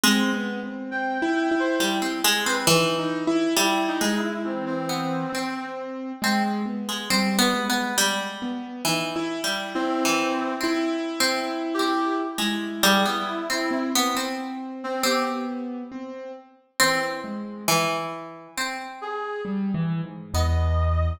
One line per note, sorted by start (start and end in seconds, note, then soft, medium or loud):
0.03 1.62 G#3 loud
0.03 0.30 C4 medium
0.33 0.60 B3 medium
0.63 0.90 C4 medium
0.91 1.18 C4 medium
0.91 1.51 G5 medium
1.22 1.49 E4 loud
1.51 1.78 E4 medium
1.60 1.79 C5 medium
1.80 2.00 G3 medium
1.80 2.20 E4 medium
2.02 2.22 C4 medium
2.24 2.44 G#3 loud
2.46 2.66 C4 medium
2.46 2.65 B4 medium
2.67 3.47 E3 loud
2.67 2.96 D#4 medium
2.99 3.25 D#4 medium
3.27 3.54 E4 loud
3.56 3.96 G3 loud
3.56 3.83 E4 medium
3.56 3.97 E4 medium
3.88 4.14 D#4 medium
4.01 4.41 G#3 medium
4.01 4.80 G#3 medium
4.16 4.43 E4 medium
4.44 5.24 E3 medium
4.44 4.64 C4 medium
4.66 5.65 C4 medium
4.89 5.29 B3 medium
5.33 6.12 C4 medium
5.33 6.14 C4 soft
6.22 6.62 G#3 medium
6.22 6.44 C4 medium
6.65 7.05 B3 medium
6.89 7.08 G#3 medium
7.10 7.50 G3 medium
7.10 7.37 C4 medium
7.39 7.65 B3 loud
7.54 8.33 G#3 medium
7.69 7.96 B3 medium
7.98 8.77 G3 loud
8.42 8.82 B3 medium
8.85 9.38 E3 medium
8.85 9.14 D#4 medium
9.16 9.42 E4 loud
9.44 9.97 G3 medium
9.44 9.72 E4 medium
9.75 10.54 C4 loud
9.75 10.54 E4 medium
10.05 10.58 E3 medium
10.60 11.13 C4 medium
10.60 12.22 E4 loud
11.20 11.73 C4 medium
11.74 12.14 G4 loud
11.79 12.32 C4 medium
12.38 12.78 G#3 medium
12.38 13.58 E4 medium
12.83 13.03 G3 loud
12.83 13.03 G#4 medium
13.05 13.45 B3 medium
13.05 13.84 E4 medium
13.50 13.90 C4 medium
13.71 14.11 C4 medium
13.95 14.15 B3 loud
14.15 14.94 C4 medium
14.15 14.96 C4 medium
14.84 15.03 C4 loud
15.03 15.83 B3 medium
15.03 16.62 C4 medium
15.03 15.23 G4 medium
15.92 16.31 C4 medium
16.80 17.20 E3 medium
16.80 17.59 C4 loud
16.80 17.01 C4 loud
17.24 17.64 G#3 medium
17.68 18.47 E3 loud
18.57 20.16 C4 medium
19.01 19.41 G#4 medium
19.45 19.71 G3 medium
19.74 20.01 E3 loud
20.04 20.31 G#2 medium
20.34 21.13 E2 medium
20.34 21.14 B3 medium
20.34 21.13 D#5 medium